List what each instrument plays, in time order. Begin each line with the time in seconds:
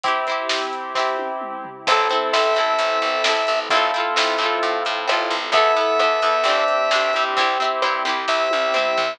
0.04 acoustic guitar (steel) C4 E4, acoustic grand piano C4 E4 G4, pad 2 (warm) C4 E4 G4, kick, closed hi-hat
0.08 acoustic guitar (steel) G4
0.27 acoustic guitar (steel) C4 E4, closed hi-hat
0.32 acoustic guitar (steel) G4
0.49 snare
0.73 closed hi-hat
0.95 acoustic guitar (steel) C4 E4, kick, snare
0.99 acoustic guitar (steel) G4
1.18 high tom
1.41 mid tom
1.65 floor tom
1.87 electric bass (finger) A1, pad 2 (warm) C4 E4 A4, acoustic grand piano C4 E4 A4, acoustic guitar (steel) C4 E4, kick, crash
1.92 acoustic guitar (steel) A4
2.10 acoustic guitar (steel) C4 E4, closed hi-hat
2.15 acoustic guitar (steel) A4
2.33 electric bass (finger) A1, acoustic guitar (steel) C4 E4, lead 1 (square) E5, snare
2.37 acoustic guitar (steel) A4
2.55 electric bass (finger) A1, acoustic guitar (steel) C4 E4, closed hi-hat
2.60 acoustic guitar (steel) A4
2.79 electric bass (finger) A1, closed hi-hat
3.02 electric bass (finger) A1, closed hi-hat
3.24 electric bass (finger) A1, acoustic guitar (steel) C4 E4, snare
3.29 acoustic guitar (steel) A4
3.47 electric bass (finger) A1, closed hi-hat
3.70 electric bass (finger) A1, acoustic grand piano C4 E4 F4 A4, pad 2 (warm) C4 E4 F4 A4, acoustic guitar (steel) C4 E4, kick, closed hi-hat
3.75 acoustic guitar (steel) F4 A4
3.94 acoustic guitar (steel) C4 E4, closed hi-hat
3.98 acoustic guitar (steel) F4 A4
4.16 electric bass (finger) A1, acoustic guitar (steel) C4 E4, snare
4.20 acoustic guitar (steel) F4 A4
4.38 electric bass (finger) A2, acoustic guitar (steel) C4 E4, closed hi-hat
4.44 acoustic guitar (steel) F4 A4
4.63 electric bass (finger) A2, closed hi-hat
4.85 electric bass (finger) A2, closed hi-hat
5.07 electric bass (finger) A1, acoustic guitar (steel) C4 E4, cross-stick
5.11 acoustic guitar (steel) F4 A4
5.30 electric bass (finger) A1, closed hi-hat
5.52 electric bass (finger) E2, acoustic grand piano B3 E4 A4, acoustic guitar (steel) B3 E4, pad 2 (warm) B3 E4 A4, lead 1 (square) E5, kick, closed hi-hat
5.57 acoustic guitar (steel) A4
5.77 acoustic guitar (steel) B3 E4, closed hi-hat
5.81 acoustic guitar (steel) A4
5.99 electric bass (finger) E2, acoustic guitar (steel) B3 E4, cross-stick
6.04 acoustic guitar (steel) A4
6.22 electric bass (finger) E2, acoustic guitar (steel) B3 E4, closed hi-hat
6.26 acoustic guitar (steel) A4
6.44 electric bass (finger) G1, acoustic grand piano C4 D4 G4, pad 2 (warm) C4 D4 G4, acoustic guitar (steel) C4, closed hi-hat
6.48 acoustic guitar (steel) D4 G4
6.68 closed hi-hat
6.91 electric bass (finger) D2, acoustic guitar (steel) C4 D4, snare
6.95 acoustic guitar (steel) G4
7.13 electric bass (finger) G2, acoustic grand piano C4 E4 G4, closed hi-hat
7.37 electric bass (finger) C2, acoustic guitar (steel) C4 E4, pad 2 (warm) C4 E4 G4, kick, closed hi-hat
7.41 acoustic guitar (steel) G4
7.60 acoustic guitar (steel) C4 E4, closed hi-hat
7.64 acoustic guitar (steel) G4
7.82 electric bass (finger) G2, acoustic guitar (steel) C4 E4, cross-stick
7.86 acoustic guitar (steel) G4
8.05 electric bass (finger) C2, acoustic guitar (steel) C4 E4, closed hi-hat
8.09 acoustic guitar (steel) G4
8.28 electric bass (finger) C2, lead 1 (square) E5, kick, snare
8.51 electric bass (finger) C2, high tom
8.74 electric bass (finger) C2, acoustic guitar (steel) C4 E4, mid tom
8.78 acoustic guitar (steel) G4
8.97 electric bass (finger) C2, floor tom